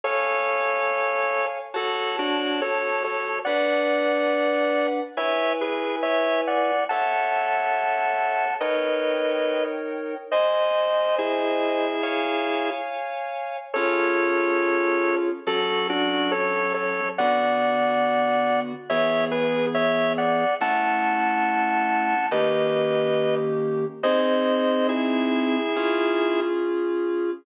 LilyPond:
<<
  \new Staff \with { instrumentName = "Drawbar Organ" } { \time 4/4 \key fis \minor \tempo 4 = 70 <a' cis''>2 <fis' a'>8 <d' fis'>8 <a' cis''>8 <a' cis''>8 | <d'' fis''>2 <cis'' e''>8 <gis' b'>8 <cis'' e''>8 <d'' fis''>8 | <fis'' a''>2 <b' dis''>4. r8 | <bis' dis''>4 <e' gis'>2 r4 |
<a' cis''>2 <fis' a'>8 <d' fis'>8 <a' cis''>8 <a' cis''>8 | <d'' fis''>2 <cis'' e''>8 <gis' b'>8 <cis'' e''>8 <d'' fis''>8 | <fis'' a''>2 <b' dis''>4. r8 | <bis' dis''>4 <e' gis'>2 r4 | }
  \new Staff \with { instrumentName = "Electric Piano 2" } { \time 4/4 \key fis \minor <cis'' eis'' gis''>2 <fis' cis'' a''>2 | <d' b' fis''>2 <e' b' gis''>2 | <a' cis'' e''>2 <dis' ais' cis'' g''>2 | <bis' dis'' gis''>2 <cis'' eis'' gis''>2 |
<cis' eis' gis'>2 <fis cis' a'>2 | <d b fis'>2 <e b gis'>2 | <a cis' e'>2 <dis ais cis' g'>2 | <bis dis' gis'>2 <cis' eis' gis'>2 | }
>>